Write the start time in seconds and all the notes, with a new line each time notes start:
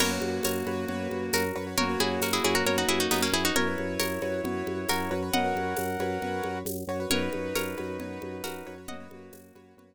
0.00 F#2 A#3 F#4 A#4 B4 C#5, crash, low conga
0.11 F#4 B4 C#5
0.21 F#2, high conga
0.43 F#2 A#4 C#5, tambourine, high conga
0.66 F#2 F#4 B4 C#5, high conga
0.88 F#2 F#4 B4 C#5, low conga
1.11 F#2, high conga
1.33 F#2 F#4 A#4, tambourine, high conga
1.56 F#2 F#4 B4 C#5
1.67 F#4 B4 C#5
1.77 F#2 A#3 F#4 A#4 C#5, low conga
1.89 F#4 B4 C#5
2.00 F#2 E4 G#4, high conga
2.21 F#2 F#4 A#4, tambourine, high conga
2.33 E4 G#4
2.44 F#2 E4 F#4 G#4 B4 C#5, high conga
2.55 F#4 A#4
2.65 F#2 F#4 A#4 B4 C#5, low conga
2.78 D#4 F#4
2.89 F#2 E4 G#4, high conga
3.00 D#4 F#4
3.11 F#2 B3 D#4, tambourine, high conga
3.22 A#3 C#4
3.32 F#2 E4 F#4 G#4 B4 C#5
3.44 D#4 F#4 B4 C#5
3.55 F#2 E4 F#4 A#4 B4 C#5, low conga
3.67 F#4 B4 C#5
3.78 F#2, high conga
4.00 F#2 A#4 C#5, tambourine, high conga
4.22 F#2 F#4 B4 C#5, high conga
4.44 F#2 F#4 B4 C#5, low conga
4.67 F#2, high conga
4.89 F#2 F#4 A#4, tambourine, high conga
5.11 F#2 F#4 B4 C#5
5.22 F#4 B4 C#5
5.32 F#2 A#4 D#5 F#5, low conga
5.44 F#4 B4 C#5
5.55 F#2, high conga
5.77 F#2, tambourine, high conga
5.99 F#2 F#4 B4 C#5, high conga
6.22 F#2 F#4 B4 C#5, low conga
6.44 F#2, high conga
6.65 F#2, tambourine, high conga
6.87 F#2 F#4 B4 C#5
7.00 F#4 B4 C#5
7.10 F#2 D#4 F#4 A#4 B4 C#5, low conga
7.22 F#4 B4 C#5
7.33 F#2, high conga
7.55 F#2 A#4 C#5, tambourine, high conga
7.78 F#2 F#4 B4 C#5, high conga
8.00 F#2 F#4 B4 C#5, low conga
8.22 F#2, high conga
8.44 F#2 F#4 A#4, tambourine, high conga
8.66 F#2 F#4 B4 C#5
8.78 F#4 B4 C#5
8.88 F#2 A#3 F#4 D#5 F#5, low conga
9.00 F#4 B4 C#5
9.11 F#2 A#3 F#4, high conga
9.33 F#2, tambourine, high conga
9.55 F#2 F#4 B4 C#5, high conga
9.77 F#2 F#4 B4 C#5, low conga